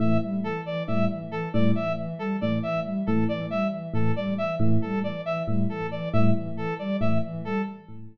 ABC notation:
X:1
M:7/8
L:1/8
Q:1/4=137
K:none
V:1 name="Electric Piano 1" clef=bass
A,, z3 A,, z2 | A,, z3 A,, z2 | A,, z3 A,, z2 | A,, z3 A,, z2 |
A,, z3 A,, z2 |]
V:2 name="Ocarina" clef=bass
E, G, E, E, G, E, E, | G, E, E, G, E, E, G, | E, E, G, E, E, G, E, | E, G, E, E, G, E, E, |
G, E, E, G, E, E, G, |]
V:3 name="Brass Section"
e z A d e z A | d e z A d e z | A d e z A d e | z A d e z A d |
e z A d e z A |]